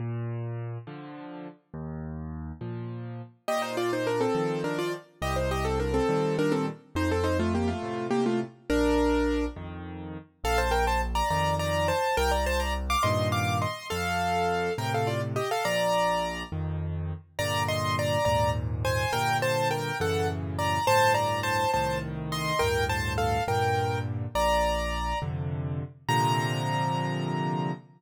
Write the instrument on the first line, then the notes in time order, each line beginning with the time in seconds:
acoustic grand piano
0.00 A#2
0.87 D3 F3
1.74 D#2
2.61 A#2 F3
3.48 A#2 G4 D#5
3.62 D#4 C5
3.77 F4 D5
3.93 D#4 C5
4.07 D4 A#4
4.21 C4 A4
4.35 D#3 F3
4.64 D4 A#4
4.79 F4 D5
5.22 C2 G4 D#5
5.36 D#4 C5
5.51 G4 D#5
5.65 C4 A4
5.80 D4 A#4
5.94 C4 A4
6.09 A#2 D#3 G3
6.39 D4 A#4
6.52 C4 A4
6.95 F2 D#4 C5
7.11 C4 A4
7.24 D#4 C5
7.39 A3 F4
7.55 A#3 G4
7.68 A3 F4
7.83 A2 C3
8.11 A#3 G4
8.26 A3 F4
8.70 A#1 D4 A#4
9.56 F2 D#3
10.44 A#1 A4 F5
10.58 C5 A5
10.71 A#4 G5
10.87 C5 A5
11.15 D5 A#5
11.30 F2 D#3 D5 A#5
11.59 D5 A#5
11.88 C5 A5
12.17 C2 A#4 G5
12.31 D5 A#5
12.46 C5 A5
12.60 D5 A#5
12.90 F5 D6
13.03 G2 A#2 D#3 D#5 C6
13.32 F5 D6
13.62 D#5 C6
13.90 F2 A4 F5
14.78 A2 C3 A#4 G5
14.94 A4 F5
15.07 F4 D5
15.36 G4 D#5
15.51 A4 F5
15.65 A#1 D5 A#5
16.52 F2 D#3
17.39 G2 A#2 D3 D5 A#5
17.68 D#5 C6
17.99 D5 A#5
18.25 D#2 G#2 A#2 D5 A#5
18.85 C5 G#5
19.13 G2 A#2 D3 A#4 G5
19.42 C5 A5
19.71 A#4 G5
20.00 F#2 A2 C#3 E3 A4 F#5
20.59 D5 A#5
20.87 D2 G2 A2 C5 A5
21.14 D5 A#5
21.43 C5 A5
21.74 C2 A2 D#3 C5 A5
22.32 D#5 C6
22.59 D2 G2 A2 A#4 G5
22.89 C5 A5
23.18 A4 F5
23.48 G2 A#2 D3 A#4 G5
24.35 A#1 D5 A#5
25.22 F2 C3 D3
26.09 A#2 C3 D3 F3 A#5